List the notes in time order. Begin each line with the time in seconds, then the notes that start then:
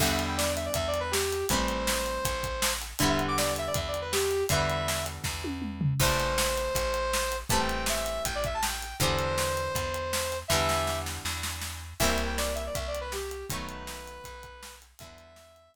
0.00 E2 D3 E3 G3 B3 E5, kick, crash
0.11 E5
0.19 closed hi-hat
0.28 G5
0.37 D5, snare
0.56 E5, closed hi-hat
0.65 D5
0.74 E2 E5, kick, closed hi-hat
0.88 D5
0.94 closed hi-hat
1.00 B4
1.11 G4, snare
1.33 closed hi-hat
1.49 A1 E3 G3 A3 C4 C5, kick, closed hi-hat
1.68 closed hi-hat
1.87 snare
2.06 closed hi-hat
2.25 A1, kick, closed hi-hat
2.43 kick, closed hi-hat
2.62 snare
2.82 closed hi-hat
2.99 E2 D3 E3 G3 E5, kick, closed hi-hat
3.03 B3
3.09 E5
3.19 closed hi-hat
3.28 D6
3.38 D5, snare
3.56 E5, closed hi-hat
3.67 D5
3.74 E2 E5, kick, closed hi-hat
3.88 D5
3.94 closed hi-hat
4.01 B4
4.12 G4, snare
4.31 closed hi-hat
4.49 E2 D3 E3 G3 B3 E5, kick, closed hi-hat
4.70 closed hi-hat
4.88 snare
5.06 closed hi-hat
5.24 E2, kick, snare
5.44 high tom
5.62 mid tom
5.81 floor tom
6.00 A1 E3 G3 A3 C4 C5, kick, crash
6.20 closed hi-hat
6.38 snare
6.58 closed hi-hat
6.75 A1, kick, closed hi-hat
6.94 closed hi-hat
7.13 snare
7.32 closed hi-hat
7.49 A1 E3 G3 A3 C4 A5, kick, closed hi-hat
7.60 G5
7.69 closed hi-hat
7.86 E5, snare
8.06 closed hi-hat
8.25 A1 G5, kick, closed hi-hat
8.35 D5
8.44 E5, kick, closed hi-hat
8.54 A5
8.63 G5, snare
8.82 closed hi-hat
9.00 E2 D3 E3 G3 B3 C5, kick, closed hi-hat
9.19 closed hi-hat
9.38 snare
9.57 closed hi-hat
9.75 E2, kick, closed hi-hat
9.94 closed hi-hat
10.13 snare
10.32 closed hi-hat
10.48 E2 D3 E3 G3 E5, kick, snare
10.53 B3
10.69 snare
10.87 snare
11.06 snare
11.25 E2, snare
11.43 snare
11.61 snare
12.00 C2 E3 G3 A#3 C4 E5, kick, crash
12.10 E5
12.18 closed hi-hat
12.26 G5
12.38 D5, snare
12.55 E5, closed hi-hat
12.66 D5
12.75 C2 E5, kick, closed hi-hat
12.87 D5
12.95 closed hi-hat
13.01 B4
13.12 G4, snare
13.31 closed hi-hat
13.50 B1 D#3 F#3 A3 B3 B4, kick, closed hi-hat
13.69 closed hi-hat
13.87 snare
14.08 closed hi-hat
14.24 B1, kick, closed hi-hat
14.43 kick, closed hi-hat
14.63 snare
14.82 closed hi-hat
14.99 E2 D3 E3 G3 E5, kick, closed hi-hat
15.03 B3
15.18 closed hi-hat
15.36 snare
15.56 closed hi-hat
15.74 kick, closed hi-hat